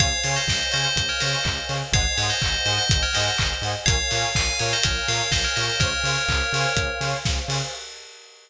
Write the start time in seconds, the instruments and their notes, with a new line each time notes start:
0.00 synth bass 1 C#2, lead 2 (sawtooth) C5 C#5 F5 G#5, pad 2 (warm) C5 C#5 F5 G#5, tubular bells C#5 F5, kick, closed hi-hat
0.24 synth bass 1 C#3, lead 2 (sawtooth) C5 C#5 F5 G#5, tubular bells C#5 F5, open hi-hat
0.36 tubular bells C5 D#5
0.47 synth bass 1 C#2, kick, snare
0.72 synth bass 1 C#3, lead 2 (sawtooth) C5 C#5 F5 G#5, tubular bells C5 D#5, open hi-hat
0.84 tubular bells C5 D#5
0.96 synth bass 1 C#2, kick, closed hi-hat
1.09 tubular bells A#4 C#5
1.20 synth bass 1 C#3, lead 2 (sawtooth) C5 C#5 F5 G#5, tubular bells C5 D#5, snare, open hi-hat
1.44 synth bass 1 C#2, kick, clap
1.69 synth bass 1 C#3, lead 2 (sawtooth) C5 C#5 F5 G#5, open hi-hat
1.92 synth bass 1 G#1, pad 2 (warm) C5 D#5 F#5 G#5, lead 2 (sawtooth) C5 D#5 F#5 G#5, tubular bells C#5 F5, kick, closed hi-hat
2.17 synth bass 1 G#2, lead 2 (sawtooth) C5 D#5 F#5 G#5, tubular bells C#5 F5, open hi-hat
2.30 tubular bells C5 D#5
2.42 synth bass 1 G#1, kick, clap
2.66 synth bass 1 G#2, lead 2 (sawtooth) C5 D#5 F#5 G#5, tubular bells C5 D#5, open hi-hat
2.78 tubular bells C5 D#5
2.90 synth bass 1 G#1, kick, closed hi-hat
3.03 tubular bells A#4 C#5
3.13 synth bass 1 G#2, lead 2 (sawtooth) C5 D#5 F#5 G#5, tubular bells C5 D#5, snare, open hi-hat
3.38 synth bass 1 G#1, kick, clap
3.62 synth bass 1 G#2, lead 2 (sawtooth) C5 D#5 F#5 G#5, open hi-hat
3.86 synth bass 1 A#1, lead 2 (sawtooth) A#4 C#5 F5 G#5, pad 2 (warm) A#4 C#5 F5 G#5, tubular bells C#5 F5, kick, closed hi-hat
4.11 synth bass 1 A#2, lead 2 (sawtooth) A#4 C#5 F5 G#5, open hi-hat
4.35 synth bass 1 A#1, tubular bells F5 G#5, kick, clap
4.59 synth bass 1 A#2, lead 2 (sawtooth) A#4 C#5 F5 G#5, tubular bells C#5 F5, open hi-hat
4.73 tubular bells C5 D#5
4.83 synth bass 1 A#1, tubular bells A#4 C#5, kick, closed hi-hat
5.07 synth bass 1 A#2, lead 2 (sawtooth) A#4 C#5 F5 G#5, tubular bells C#5 F5, snare, open hi-hat
5.31 synth bass 1 A#1, tubular bells C5 D#5, kick, snare
5.44 tubular bells A#4 C#5
5.56 synth bass 1 A#2, lead 2 (sawtooth) A#4 C#5 F5 G#5, tubular bells C5 D#5, open hi-hat
5.80 synth bass 1 C#2, tubular bells A#4 C#5, pad 2 (warm) C5 C#5 F5 G#5, lead 2 (sawtooth) C5 C#5 F5 G#5, kick, closed hi-hat
6.04 synth bass 1 C#3, lead 2 (sawtooth) C5 C#5 F5 G#5, open hi-hat
6.28 synth bass 1 C#2, kick, clap
6.53 synth bass 1 C#3, lead 2 (sawtooth) C5 C#5 F5 G#5, open hi-hat
6.76 synth bass 1 C#2, kick, closed hi-hat
7.01 synth bass 1 C#3, lead 2 (sawtooth) C5 C#5 F5 G#5, snare, open hi-hat
7.25 synth bass 1 C#2, kick, snare
7.48 synth bass 1 C#3, lead 2 (sawtooth) C5 C#5 F5 G#5, open hi-hat